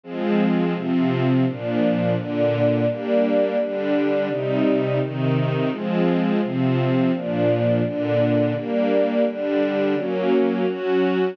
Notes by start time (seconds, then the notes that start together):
0.04 F3 G#3 C4
0.74 C3 F3 C4
1.45 A#2 F3 D4
2.16 A#2 D3 D4
2.87 G3 A#3 D4
3.58 D3 G3 D4
4.29 C3 G3 D#4
5.00 C3 D#3 D#4
5.70 F3 G#3 C4
6.41 C3 F3 C4
7.12 A#2 F3 D4
7.83 A#2 D3 D4
8.54 G3 A#3 D4
9.25 D3 G3 D4
9.96 F#3 A#3 C#4
10.67 F#3 C#4 F#4